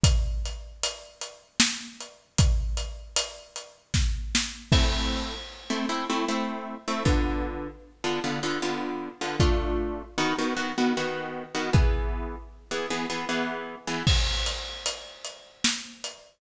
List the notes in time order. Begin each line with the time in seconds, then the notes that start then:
0.03 kick, closed hi-hat
0.45 closed hi-hat
0.83 closed hi-hat
1.21 closed hi-hat
1.60 snare
2.00 closed hi-hat
2.38 kick, closed hi-hat
2.77 closed hi-hat
3.16 closed hi-hat
3.56 closed hi-hat
3.94 kick, snare
4.35 snare
4.72 A3 C4 E4, kick, crash
5.70 A3 C4 E4
5.89 A3 C4 E4
6.10 A3 C4 E4
6.28 A3 C4 E4
6.88 A3 C4 E4
7.05 D3 B3 F4, kick
8.04 D3 B3 F4
8.24 D3 B3 F4
8.43 D3 B3 F4
8.62 D3 B3 F4
9.21 D3 B3 F4
9.40 A3 D4 F4, kick
10.18 D#3 B3 F#4
10.38 D#3 B3 F#4
10.56 D#3 B3 F#4
10.78 D#3 B3 F#4
10.97 D#3 B3 F#4
11.55 D#3 B3 F#4
11.73 E3 B3 G#4, kick
12.71 E3 B3 G#4
12.90 E3 B3 G#4
13.10 E3 B3 G#4
13.29 E3 B3 G#4
13.87 E3 B3 G#4
14.07 kick, crash
14.46 closed hi-hat
14.86 closed hi-hat
15.25 closed hi-hat
15.64 snare
16.04 closed hi-hat